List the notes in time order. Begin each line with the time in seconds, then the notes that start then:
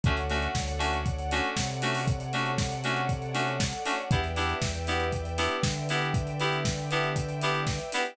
0.03 D2 A3 C#4 D4 F#4 A4 C#5 D5 F#5, kick, closed hi-hat
0.17 closed hi-hat
0.30 A3 C#4 D4 F#4, open hi-hat
0.42 closed hi-hat
0.55 D2, kick, snare
0.68 closed hi-hat
0.79 A3 C#4 D4 F#4, open hi-hat
0.93 closed hi-hat
1.06 kick, closed hi-hat
1.19 closed hi-hat
1.31 A3 C#4 D4 F#4, open hi-hat
1.44 closed hi-hat
1.57 C3, kick, snare
1.69 closed hi-hat
1.82 A3 C#4 D4 F#4, open hi-hat
1.95 open hi-hat
2.07 kick, closed hi-hat
2.20 closed hi-hat
2.33 A3 C#4 D4 F#4, open hi-hat
2.46 closed hi-hat
2.58 kick, snare
2.71 closed hi-hat
2.84 A3 C#4 D4 F#4, open hi-hat
2.96 closed hi-hat
3.09 kick, closed hi-hat
3.22 closed hi-hat
3.34 A3 C#4 D4 F#4, open hi-hat
3.47 closed hi-hat
3.60 kick, snare
3.73 closed hi-hat
3.85 A3 C#4 D4 F#4, open hi-hat
3.98 closed hi-hat
4.11 E2 B3 D4 E4 G4 B4 D5 E5 G5, kick, closed hi-hat
4.24 closed hi-hat
4.36 B3 D4 E4 G4, open hi-hat
4.49 closed hi-hat
4.62 E2, kick, snare
4.74 closed hi-hat
4.87 B3 D4 E4 G4, open hi-hat
5.00 closed hi-hat
5.13 kick, closed hi-hat
5.25 closed hi-hat
5.38 B3 D4 E4 G4, open hi-hat
5.51 closed hi-hat
5.63 D3, kick, snare
5.76 closed hi-hat
5.89 B3 D4 E4 G4, open hi-hat
6.02 closed hi-hat
6.14 kick, closed hi-hat
6.27 closed hi-hat
6.40 B3 D4 E4 G4, open hi-hat
6.52 closed hi-hat
6.65 kick, snare
6.78 closed hi-hat
6.91 B3 D4 E4 G4, open hi-hat
7.03 closed hi-hat
7.16 kick, closed hi-hat
7.29 closed hi-hat
7.41 B3 D4 E4 G4, open hi-hat
7.54 closed hi-hat
7.67 kick, snare
7.80 closed hi-hat
7.92 B3 D4 E4 G4, open hi-hat
8.05 closed hi-hat